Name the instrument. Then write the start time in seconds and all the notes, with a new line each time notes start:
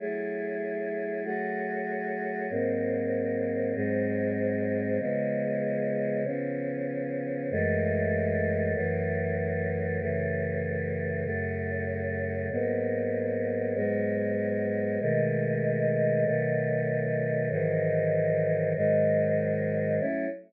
choir aahs
0.00 F#3 A3 E4 G#4
1.24 F#3 A3 F#4 G#4
2.50 G#2 F#3 A#3 C4
3.75 G#2 F#3 G#3 C4
4.99 C#3 F3 G#3 B3
6.25 C#3 F3 B3 C#4
7.51 F#2 E3 G#3 A3
8.75 F#2 E3 F#3 A3
10.00 F#2 C#3 E3 A3
11.24 F#2 C#3 F#3 A3
12.51 G#2 F#3 A#3 B3
13.75 G#2 F#3 G#3 B3
15.00 B2 D#3 G#3 A3
16.25 B2 D#3 F#3 A3
17.50 G#2 D#3 E3 F#3
18.76 G#2 D#3 F#3 G#3
20.00 F#3 A3 C#4 E4